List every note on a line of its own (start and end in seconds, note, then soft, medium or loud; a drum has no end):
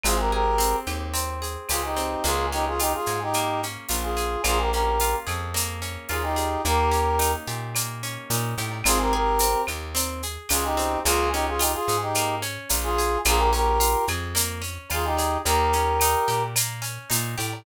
0.03 0.75 G#1 medium
0.03 0.58 C4 medium
0.03 0.17 F4 medium
0.03 0.17 G#4 loud
0.03 cowbell loud
0.03 claves loud
0.03 shaker loud
0.19 0.32 G4 medium
0.19 0.32 A#4 medium
0.32 0.76 G4 medium
0.32 1.41 G#4 medium
0.32 0.76 A#4 loud
0.58 1.13 C4 medium
0.58 tambourine medium
0.58 shaker loud
0.86 1.57 D#2 medium
0.86 1.70 G4 medium
0.86 claves loud
0.86 shaker medium
1.14 1.96 C4 medium
1.14 cowbell medium
1.14 shaker loud
1.42 2.20 G#4 medium
1.42 shaker medium
1.69 2.16 C#2 medium
1.69 1.82 F4 medium
1.69 2.23 G4 medium
1.69 1.82 G#4 medium
1.69 tambourine medium
1.69 cowbell medium
1.69 claves loud
1.69 shaker loud
1.84 2.24 D#4 medium
1.84 2.24 G4 medium
1.96 2.23 C4 medium
1.96 cowbell medium
1.96 shaker medium
2.24 2.95 C#2 medium
2.24 3.34 A#3 medium
2.24 2.46 F4 medium
2.24 2.46 G#4 loud
2.24 cowbell loud
2.24 shaker loud
2.52 3.63 C#4 medium
2.52 2.65 D#4 loud
2.52 2.65 G4 loud
2.52 shaker medium
2.67 2.80 F4 medium
2.67 2.80 G#4 loud
2.79 2.93 D#4 loud
2.79 3.89 F4 medium
2.79 2.93 G4 loud
2.79 tambourine medium
2.79 claves medium
2.79 shaker loud
2.94 3.19 F4 medium
2.94 3.19 G#4 medium
3.06 3.77 G#2 medium
3.06 4.16 G#4 medium
3.06 shaker medium
3.22 3.61 D#4 medium
3.22 3.61 G4 loud
3.33 4.39 A#3 medium
3.33 cowbell medium
3.33 claves loud
3.33 shaker loud
3.63 4.42 C#4 medium
3.63 shaker medium
3.89 4.37 A#1 medium
3.89 4.41 F4 medium
3.89 tambourine medium
3.89 cowbell medium
3.89 shaker loud
4.02 4.42 F4 medium
4.02 4.42 G#4 medium
4.17 4.43 G#4 medium
4.17 shaker medium
4.44 5.15 A#1 medium
4.44 5.54 A#3 medium
4.44 4.58 F4 loud
4.44 4.58 G#4 loud
4.44 cowbell loud
4.44 claves loud
4.44 shaker loud
4.59 4.71 G4 medium
4.59 4.71 A#4 medium
4.71 5.81 C#4 medium
4.71 5.15 G4 medium
4.71 5.15 A#4 medium
4.71 shaker medium
5.00 6.09 F4 medium
5.00 tambourine medium
5.00 shaker loud
5.26 5.97 F2 medium
5.26 6.36 G#4 medium
5.26 claves loud
5.26 shaker medium
5.54 6.59 A#3 medium
5.54 cowbell medium
5.54 shaker loud
5.82 6.60 C#4 medium
5.82 shaker medium
6.09 6.57 D#2 medium
6.09 6.62 F4 medium
6.09 6.23 F4 medium
6.09 6.23 G#4 medium
6.09 tambourine medium
6.09 cowbell medium
6.09 claves medium
6.23 6.62 D#4 medium
6.23 6.62 G4 loud
6.36 6.62 G#4 medium
6.36 cowbell loud
6.36 shaker medium
6.65 7.35 D#2 medium
6.65 7.75 A#3 medium
6.65 7.32 G4 loud
6.65 7.32 A#4 loud
6.65 cowbell loud
6.65 shaker loud
6.91 8.03 C#4 medium
6.91 shaker medium
7.19 8.30 D#4 medium
7.19 tambourine medium
7.19 claves medium
7.19 shaker loud
7.47 8.18 A#2 medium
7.47 8.58 G4 medium
7.47 shaker medium
7.75 8.80 A#3 medium
7.75 cowbell medium
7.75 claves loud
7.75 shaker loud
8.03 8.82 C#4 medium
8.03 shaker medium
8.30 8.55 A#2 medium
8.30 8.83 D#4 medium
8.30 tambourine medium
8.30 cowbell medium
8.30 shaker loud
8.57 8.82 A2 medium
8.57 8.84 G4 medium
8.57 shaker medium
8.71 cowbell medium
8.84 9.55 G#1 medium
8.84 9.14 C4 medium
8.84 8.98 F4 loud
8.84 8.98 G#4 loud
8.84 cowbell loud
8.84 claves loud
8.84 shaker loud
9.00 9.13 G4 medium
9.00 9.13 A#4 loud
9.13 9.62 G4 medium
9.13 9.40 G#4 medium
9.13 9.62 A#4 loud
9.39 9.68 C4 medium
9.39 tambourine medium
9.39 shaker loud
9.67 10.38 D#2 medium
9.67 9.96 G4 medium
9.67 claves loud
9.67 shaker medium
9.95 10.22 C4 medium
9.95 cowbell loud
9.95 shaker loud
10.23 10.51 G#4 medium
10.23 shaker medium
10.49 10.97 C#2 medium
10.49 10.64 F4 medium
10.49 10.76 G4 medium
10.49 10.64 G#4 loud
10.49 tambourine medium
10.49 cowbell loud
10.49 claves loud
10.49 shaker loud
10.64 10.99 D#4 medium
10.64 10.99 G4 loud
10.77 11.03 C4 medium
10.77 cowbell medium
10.77 shaker medium
11.04 11.75 C#2 loud
11.04 11.34 A#3 medium
11.04 11.29 F4 loud
11.04 11.29 G#4 loud
11.04 cowbell loud
11.04 shaker loud
11.33 11.61 C#4 medium
11.33 11.46 D#4 loud
11.33 11.46 G4 loud
11.33 shaker medium
11.47 11.61 F4 medium
11.47 11.61 G#4 loud
11.59 11.72 D#4 medium
11.59 11.87 F4 medium
11.59 11.72 G4 loud
11.59 tambourine loud
11.59 claves medium
11.59 shaker loud
11.74 11.97 F4 medium
11.74 11.97 G#4 loud
11.88 12.58 G#2 medium
11.88 12.17 G#4 medium
11.88 shaker loud
12.01 12.35 D#4 medium
12.01 12.35 G4 loud
12.15 12.43 A#3 medium
12.15 cowbell medium
12.15 claves loud
12.15 shaker loud
12.42 12.70 C#4 medium
12.42 shaker medium
12.69 13.17 A#1 medium
12.69 12.98 F4 medium
12.69 tambourine loud
12.69 cowbell medium
12.69 shaker loud
12.83 13.18 F4 loud
12.83 13.18 G#4 loud
12.98 13.24 G#4 medium
12.98 shaker loud
13.25 13.96 A#1 loud
13.25 13.53 A#3 loud
13.25 13.40 F4 loud
13.25 13.40 G#4 loud
13.25 cowbell loud
13.25 claves loud
13.25 shaker loud
13.37 13.50 G4 medium
13.37 13.50 A#4 loud
13.53 13.80 C#4 medium
13.53 14.05 G4 medium
13.53 14.05 A#4 loud
13.53 shaker medium
13.80 14.08 F4 medium
13.80 tambourine loud
13.80 shaker loud
14.07 14.78 F2 medium
14.07 14.36 G#4 medium
14.07 claves loud
14.07 shaker medium
14.35 14.62 A#3 medium
14.35 cowbell loud
14.35 shaker loud
14.62 14.89 C#4 medium
14.62 shaker medium
14.90 15.37 D#2 medium
14.90 15.19 F4 medium
14.90 15.05 F4 medium
14.90 15.05 G#4 loud
14.90 tambourine medium
14.90 cowbell loud
14.90 claves loud
15.05 15.38 D#4 medium
15.05 15.38 G4 loud
15.17 15.44 G#4 medium
15.17 cowbell loud
15.17 shaker loud
15.44 16.16 D#2 loud
15.44 15.74 A#3 medium
15.44 16.43 G4 medium
15.44 16.43 A#4 loud
15.44 cowbell loud
15.44 shaker loud
15.73 16.01 C#4 medium
15.73 shaker medium
16.00 16.29 D#4 medium
16.00 tambourine loud
16.00 claves loud
16.00 shaker loud
16.28 16.98 A#2 medium
16.28 16.55 G4 medium
16.28 shaker medium
16.56 16.85 A#3 medium
16.56 cowbell loud
16.56 claves loud
16.56 shaker loud
16.82 17.09 C#4 medium
16.82 shaker medium
17.10 17.35 A#2 medium
17.10 17.37 D#4 medium
17.10 tambourine loud
17.10 cowbell loud
17.10 shaker loud
17.38 17.63 A2 medium
17.38 17.64 G4 medium
17.38 shaker loud
17.53 cowbell medium